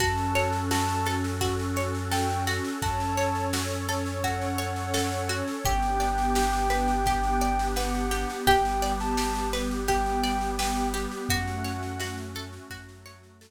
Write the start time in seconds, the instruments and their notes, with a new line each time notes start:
0.00 synth bass 2 F#2, pad 2 (warm) C#4 F#4 A4, pizzicato strings F#4, ocarina A5, kick, snare
0.17 snare
0.35 pizzicato strings C#5, snare
0.52 snare
0.71 pizzicato strings F#4, ocarina A5, snare
0.89 snare
1.06 pizzicato strings A4, snare
1.24 snare
1.41 pizzicato strings F#4, kick, snare
1.59 snare
1.76 pizzicato strings C#5, snare
1.95 snare
2.11 pizzicato strings A4, ocarina G5, snare
2.29 snare
2.47 pizzicato strings F#4, snare
2.64 snare
2.82 synth bass 2 F#2, pad 2 (warm) C#4 A4 C#5, pizzicato strings F#4, ocarina A5, kick, snare
3.00 snare
3.17 pizzicato strings C#5, snare
3.35 snare
3.53 pizzicato strings F#4, snare
3.70 snare
3.89 pizzicato strings A4, snare
4.06 snare
4.23 pizzicato strings F#4, ocarina F#5, kick, snare
4.41 snare
4.58 pizzicato strings C#5, snare
4.76 snare
4.94 pizzicato strings A4, ocarina F#5, snare
5.12 snare
5.29 pizzicato strings F#4, snare
5.48 snare
5.65 synth bass 2 G1, pad 2 (warm) B3 D4 G4, pizzicato strings G4, ocarina G5, kick, snare
5.82 snare
6.00 pizzicato strings D5, snare
6.18 snare
6.35 pizzicato strings G4, snare
6.53 snare
6.70 pizzicato strings B4, snare
6.88 snare
7.06 pizzicato strings G4, kick, snare
7.24 snare
7.41 pizzicato strings D5, snare
7.59 snare
7.76 pizzicato strings B4, ocarina F#5, snare
7.94 snare
8.11 pizzicato strings G4, snare
8.30 snare
8.47 synth bass 2 G1, pad 2 (warm) G3 B3 G4, pizzicato strings G4, ocarina G5, kick, snare
8.65 snare
8.82 pizzicato strings D5, snare
9.00 ocarina A5, snare
9.17 pizzicato strings G4, snare
9.35 snare
9.53 pizzicato strings B4, snare
9.71 snare
9.88 pizzicato strings G4, ocarina G5, kick, snare
10.06 snare
10.24 pizzicato strings D5, snare
10.41 snare
10.59 pizzicato strings B4, ocarina G5, snare
10.77 snare
10.94 pizzicato strings G4, snare
11.11 snare
11.29 synth bass 2 F#2, pad 2 (warm) A3 C#4 F#4, pizzicato strings F#4, ocarina F#5, kick, snare
11.47 snare
11.64 pizzicato strings C#5, snare
11.83 snare
12.00 pizzicato strings F#4, snare
12.17 snare
12.35 pizzicato strings A4, snare
12.53 snare
12.70 synth bass 2 F#2, pad 2 (warm) F#3 A3 F#4, pizzicato strings F#4, kick, snare
12.89 snare
13.06 pizzicato strings C#5, snare
13.23 snare
13.41 pizzicato strings A4, snare